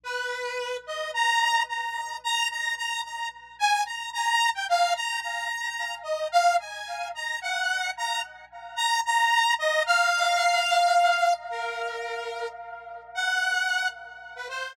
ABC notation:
X:1
M:6/8
L:1/16
Q:3/8=73
K:none
V:1 name="Lead 2 (sawtooth)"
B6 _e2 _b4 | _b4 b2 b2 b2 b2 | z2 _a2 _b2 b3 g f2 | _b2 b6 _e2 f2 |
_a4 _b2 _g4 b2 | z4 _b2 b4 _e2 | f12 | _B8 z4 |
_g6 z3 B c2 |]